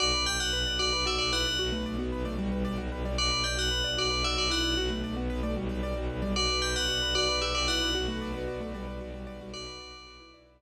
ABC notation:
X:1
M:12/8
L:1/8
Q:3/8=151
K:Bphr
V:1 name="Tubular Bells"
d2 g f3 d2 e d f2 | z12 | d2 g f3 d2 e d f2 | z12 |
d2 g f3 d2 e d f2 | z12 | d6 z6 |]
V:2 name="Acoustic Grand Piano"
z6 F z F2 E2 | F A,2 B,2 A, G,3 G,2 G, | z6 F z F2 E2 | F A,2 B,2 A, G,3 G,2 G, |
z6 F z G2 E2 | F A,2 B,2 A, G,3 G,2 G, | F5 E3 z4 |]
V:3 name="Acoustic Grand Piano"
F B d F B d F B d F B d | F B d F B d F B d F B d | F B d F B d F B d F B d | F B d F B d F B d F B d |
F B d B F B d B F B d B | F B d B F B d B F B d F- | F B d B F B d B F z3 |]
V:4 name="Violin" clef=bass
B,,, B,,, B,,, B,,, B,,, B,,, B,,, B,,, B,,, B,,, B,,, B,,, | B,,, B,,, B,,, B,,, B,,, B,,, B,,, B,,, B,,, B,,, B,,, B,,, | B,,, B,,, B,,, B,,, B,,, B,,, B,,, B,,, B,,, B,,, B,,, B,,, | B,,, B,,, B,,, B,,, B,,, B,,, B,,, B,,, B,,, B,,, B,,, B,,, |
B,,, B,,, B,,, B,,, B,,, B,,, B,,, B,,, B,,, B,,, B,,, B,,, | B,,, B,,, B,,, B,,, B,,, B,,, B,,, B,,, B,,, B,,, B,,, B,,, | B,,, B,,, B,,, B,,, B,,, B,,, B,,, B,,, B,,, z3 |]